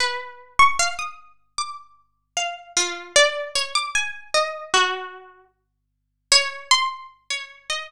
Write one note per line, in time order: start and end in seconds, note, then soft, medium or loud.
0.00 0.53 B4 medium
0.59 0.77 C#6 loud
0.79 0.97 F5 medium
0.99 1.52 D#6 medium
1.58 2.29 D6 medium
2.37 2.72 F5 medium
2.76 3.12 F4 medium
3.16 3.51 D5 loud
3.55 3.73 C#5 medium
3.75 3.93 D6 medium
3.95 4.30 G#5 medium
4.34 4.70 D#5 medium
4.74 5.45 F#4 medium
6.32 6.67 C#5 loud
6.71 7.07 C6 loud
7.30 7.66 C#5 medium
7.70 7.87 D#5 medium